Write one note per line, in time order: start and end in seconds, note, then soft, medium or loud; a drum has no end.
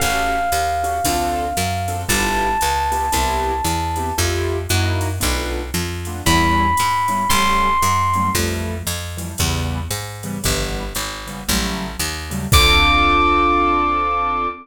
0.00 0.50 A1 medium
0.00 0.39 C#4 medium
0.00 0.39 F#4 medium
0.00 0.39 G4 medium
0.00 0.39 A4 medium
0.00 2.00 F5 medium
0.00 kick medium
0.00 ride medium
0.52 1.00 D#2 medium
0.52 hi-hat pedal medium
0.52 ride medium
0.83 0.98 C#4 medium
0.83 0.98 F#4 medium
0.83 0.98 G4 medium
0.83 0.98 A4 medium
0.83 ride medium
1.04 1.53 D2 medium
1.04 1.46 C4 medium
1.04 1.46 D4 medium
1.04 1.46 F4 medium
1.04 1.46 A4 medium
1.04 kick medium
1.04 ride loud
1.57 2.05 F#2 medium
1.57 hi-hat pedal medium
1.57 ride medium
1.88 2.03 C4 medium
1.88 2.03 D4 medium
1.88 2.03 F4 medium
1.88 2.03 A4 medium
1.88 ride medium
2.08 2.57 G1 medium
2.08 2.48 B3 medium
2.08 2.48 E4 medium
2.08 2.48 F4 medium
2.08 2.48 G4 medium
2.08 4.15 A5 medium
2.08 kick medium
2.08 ride loud
2.61 3.10 C#2 medium
2.61 hi-hat pedal medium
2.61 ride medium
2.92 3.06 B3 medium
2.92 3.06 E4 medium
2.92 3.06 F4 medium
2.92 3.06 G4 medium
2.92 ride medium
3.12 3.61 C2 medium
3.12 3.52 B3 medium
3.12 3.52 C4 medium
3.12 3.52 E4 medium
3.12 3.52 G4 medium
3.12 kick soft
3.12 ride medium
3.64 4.12 E2 medium
3.64 hi-hat pedal medium
3.64 ride medium
3.96 4.11 B3 medium
3.96 4.11 C4 medium
3.96 4.11 E4 medium
3.96 4.11 G4 medium
3.96 ride medium
4.18 4.67 F2 medium
4.18 4.57 A3 medium
4.18 4.57 E4 medium
4.18 4.57 F4 medium
4.18 4.57 G4 medium
4.18 kick soft
4.18 ride medium
4.69 5.19 F#2 medium
4.69 5.09 A#3 medium
4.69 5.09 D#4 medium
4.69 5.09 E4 medium
4.69 5.09 F#4 medium
4.69 hi-hat pedal medium
4.69 ride medium
5.01 ride medium
5.20 5.71 B1 medium
5.20 5.60 A3 medium
5.20 5.60 B3 medium
5.20 5.60 D4 medium
5.20 5.60 F4 medium
5.20 kick medium
5.20 ride medium
5.74 6.22 F2 medium
5.74 hi-hat pedal medium
5.74 ride medium
6.05 6.22 A3 medium
6.05 6.22 B3 medium
6.05 6.22 D4 medium
6.05 6.22 F4 medium
6.05 ride medium
6.26 6.74 E2 medium
6.26 6.66 G3 medium
6.26 6.66 B3 medium
6.26 6.66 C#4 medium
6.26 6.66 E4 medium
6.26 7.27 B5 medium
6.26 kick medium
6.26 ride medium
6.77 7.27 G#2 medium
6.77 hi-hat pedal medium
6.77 ride medium
7.08 7.23 G3 medium
7.08 7.23 B3 medium
7.08 7.23 C#4 medium
7.08 7.23 E4 medium
7.08 ride medium
7.29 7.78 A1 medium
7.29 7.69 F#3 medium
7.29 7.69 G3 medium
7.29 7.69 A3 medium
7.29 7.69 C#4 medium
7.29 8.29 C6 medium
7.29 kick medium
7.29 ride medium
7.82 8.30 F#2 medium
7.82 hi-hat pedal medium
7.82 ride medium
8.13 8.30 F#3 medium
8.13 8.30 G3 medium
8.13 8.30 A3 medium
8.13 8.30 C#4 medium
8.13 ride medium
8.35 8.83 F2 medium
8.35 8.75 E3 medium
8.35 8.75 F3 medium
8.35 8.75 G3 medium
8.35 8.75 A3 medium
8.35 kick medium
8.35 ride medium
8.87 9.35 F2 medium
8.87 hi-hat pedal medium
8.87 ride medium
9.17 9.32 E3 medium
9.17 9.32 F3 medium
9.17 9.32 G3 medium
9.17 9.32 A3 medium
9.17 ride medium
9.38 9.88 E2 medium
9.38 9.79 C#3 medium
9.38 9.79 E3 medium
9.38 9.79 G3 medium
9.38 9.79 B3 medium
9.38 kick medium
9.38 ride medium
9.91 10.38 G#2 medium
9.91 hi-hat pedal medium
9.91 ride medium
10.23 10.38 C#3 medium
10.23 10.38 E3 medium
10.23 10.38 G3 medium
10.23 10.38 B3 medium
10.23 ride medium
10.43 10.93 G1 medium
10.43 10.83 C#3 medium
10.43 10.83 E3 medium
10.43 10.83 G3 medium
10.43 10.83 B3 medium
10.43 kick medium
10.43 ride medium
10.95 11.44 G#1 medium
10.95 hi-hat pedal medium
10.95 ride medium
11.27 11.41 C#3 medium
11.27 11.41 E3 medium
11.27 11.41 G3 medium
11.27 11.41 B3 medium
11.27 ride medium
11.48 11.97 A1 medium
11.48 11.88 C#3 medium
11.48 11.88 F#3 medium
11.48 11.88 G3 medium
11.48 11.88 A3 medium
11.48 kick medium
11.48 ride medium
11.99 12.47 D#2 medium
11.99 hi-hat pedal medium
11.99 ride medium
12.30 12.45 C#3 medium
12.30 12.45 F#3 medium
12.30 12.45 G3 medium
12.30 12.45 A3 medium
12.30 ride medium
12.52 14.48 D2 loud
12.52 14.47 C4 loud
12.52 14.47 D4 medium
12.52 14.47 F4 loud
12.52 14.47 A4 loud
12.52 14.48 D6 loud
12.52 kick loud
12.52 crash loud